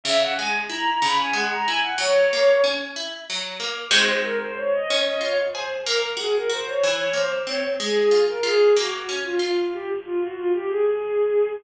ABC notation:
X:1
M:6/8
L:1/16
Q:3/8=62
K:B
V:1 name="Violin"
e f g z a a b g f a g f | c4 z8 | [K:Db] c z B c d e z e d z c z | B z A B c d z d c z d z |
A3 B A2 G2 z F F2 | =G z F _G F =G A6 |]
V:2 name="Orchestral Harp"
C,2 G,2 E2 C,2 G,2 E2 | F,2 A,2 C2 E2 F,2 A,2 | [K:Db] [A,CEG]6 D2 F2 A2 | B,2 G2 G2 =E,2 B,2 C2 |
A,2 F2 F2 B,2 D2 F2 | z12 |]